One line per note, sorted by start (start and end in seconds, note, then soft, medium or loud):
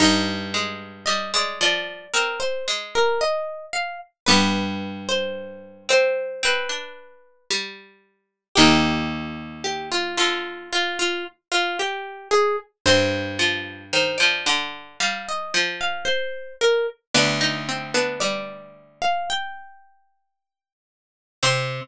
0.00 2.78 G2 loud
0.00 4.03 D#4 loud
0.00 0.88 D#5 medium
0.54 1.03 G#3 loud
1.06 1.32 G3 loud
1.06 1.31 D#5 medium
1.34 1.59 G#3 loud
1.34 1.60 D5 medium
1.61 2.05 F3 loud
1.61 2.09 D5 medium
2.14 2.61 C4 loud
2.14 2.39 A#4 medium
2.40 2.65 C5 medium
2.68 3.57 G#3 loud
2.95 3.21 A#4 medium
3.21 3.66 D#5 medium
3.73 3.99 F5 medium
4.26 7.13 G2 loud
4.26 5.20 G3 loud
4.26 8.10 B3 loud
4.26 5.20 B3 loud
4.26 5.02 B4 medium
5.09 5.83 C5 medium
5.89 6.41 C4 loud
5.89 6.42 C5 loud
6.43 6.69 C4 loud
6.43 7.45 B4 medium
6.69 7.45 D4 medium
7.50 8.44 G3 loud
8.56 11.33 D#2 loud
8.56 10.04 C3 loud
8.56 10.04 D#3 loud
8.56 10.55 D#4 loud
8.56 9.60 G4 medium
9.64 9.90 G4 medium
9.92 10.17 F4 medium
10.17 11.10 D3 loud
10.17 10.69 F4 medium
10.73 10.98 F4 medium
10.99 11.25 F4 medium
11.52 11.77 F4 medium
11.79 12.28 G4 medium
12.31 12.56 G#4 medium
12.86 15.54 G2 loud
12.86 16.33 C4 loud
12.86 13.81 C5 medium
13.39 13.84 F3 loud
13.93 14.18 D#3 loud
13.93 14.19 C5 medium
14.18 14.45 F3 loud
14.18 14.43 D5 medium
14.46 14.96 D3 loud
14.46 14.94 D5 medium
15.00 15.50 G3 loud
15.00 15.26 F5 medium
15.29 15.54 D#5 medium
15.54 16.46 F3 loud
15.81 16.06 F5 medium
16.05 16.53 C5 medium
16.61 16.87 A#4 medium
17.15 19.63 D2 loud
17.15 17.60 B3 loud
17.15 17.40 D4 loud
17.15 18.14 D5 medium
17.41 17.88 D#4 loud
17.69 17.94 C4 medium
17.94 19.19 B3 medium
17.94 18.20 D4 loud
18.20 19.22 G3 loud
18.20 18.97 D5 medium
19.02 19.27 F5 medium
19.30 20.71 G5 medium
21.43 21.81 C3 loud
21.43 21.80 C4 loud
21.43 21.81 C4 loud
21.43 21.81 C6 loud